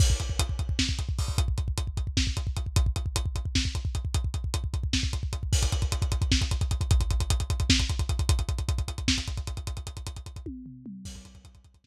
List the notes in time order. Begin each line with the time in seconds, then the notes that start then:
0.00 kick, crash
0.10 kick
0.20 kick, closed hi-hat
0.30 kick
0.39 kick, closed hi-hat
0.49 kick
0.59 kick, closed hi-hat
0.69 kick
0.79 kick, snare
0.89 kick
0.99 kick, closed hi-hat
1.09 kick
1.19 kick, open hi-hat
1.28 kick
1.38 kick, closed hi-hat
1.48 kick
1.58 kick, closed hi-hat
1.68 kick
1.78 kick, closed hi-hat
1.87 kick
1.97 kick, closed hi-hat
2.07 kick
2.17 kick, snare
2.27 kick
2.37 kick, closed hi-hat
2.47 kick
2.57 kick, closed hi-hat
2.66 kick
2.76 kick, closed hi-hat
2.86 kick
2.96 kick, closed hi-hat
3.06 kick
3.16 kick, closed hi-hat
3.26 kick
3.36 kick, closed hi-hat
3.45 kick
3.55 kick, snare
3.65 kick
3.75 kick, closed hi-hat
3.85 kick
3.95 kick, closed hi-hat
4.05 kick
4.14 kick, closed hi-hat
4.24 kick
4.34 kick, closed hi-hat
4.44 kick
4.54 kick, closed hi-hat
4.64 kick
4.74 kick, closed hi-hat
4.83 kick
4.93 kick, snare
5.03 kick
5.13 kick, closed hi-hat
5.23 kick
5.33 kick, closed hi-hat
5.43 kick
5.53 kick, crash
5.63 kick, closed hi-hat
5.72 kick, closed hi-hat
5.82 kick, closed hi-hat
5.92 kick, closed hi-hat
6.02 kick, closed hi-hat
6.12 kick, closed hi-hat
6.22 kick, closed hi-hat
6.32 kick, snare
6.41 kick, closed hi-hat
6.51 kick, closed hi-hat
6.61 kick, closed hi-hat
6.71 kick, closed hi-hat
6.81 kick, closed hi-hat
6.91 kick, closed hi-hat
7.00 kick, closed hi-hat
7.11 kick, closed hi-hat
7.20 kick, closed hi-hat
7.30 kick, closed hi-hat
7.40 kick, closed hi-hat
7.50 kick, closed hi-hat
7.60 kick, closed hi-hat
7.70 kick, snare
7.80 kick, closed hi-hat
7.89 kick, closed hi-hat
7.99 kick, closed hi-hat
8.09 kick, closed hi-hat
8.19 kick, closed hi-hat
8.29 kick, closed hi-hat
8.39 kick, closed hi-hat
8.49 kick, closed hi-hat
8.58 kick, closed hi-hat
8.69 kick, closed hi-hat
8.78 kick, closed hi-hat
8.88 kick, closed hi-hat
8.98 kick, closed hi-hat
9.08 kick, snare
9.18 kick, closed hi-hat
9.28 kick, closed hi-hat
9.37 kick, closed hi-hat
9.47 kick, closed hi-hat
9.57 kick, closed hi-hat
9.67 kick, closed hi-hat
9.77 kick, closed hi-hat
9.87 kick, closed hi-hat
9.97 kick, closed hi-hat
10.07 kick, closed hi-hat
10.16 kick, closed hi-hat
10.26 kick, closed hi-hat
10.36 kick, closed hi-hat
10.46 kick, high tom
10.66 floor tom
10.86 mid tom
11.05 kick, crash
11.15 kick, closed hi-hat
11.25 kick, closed hi-hat
11.35 kick, closed hi-hat
11.45 kick, closed hi-hat
11.55 kick, closed hi-hat
11.64 kick, closed hi-hat
11.74 kick, closed hi-hat
11.84 kick, snare